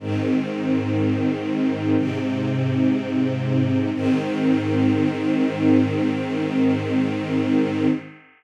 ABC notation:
X:1
M:4/4
L:1/8
Q:1/4=61
K:Ab
V:1 name="String Ensemble 1"
[A,,E,C]4 [A,,C,C]4 | [A,,E,C]8 |]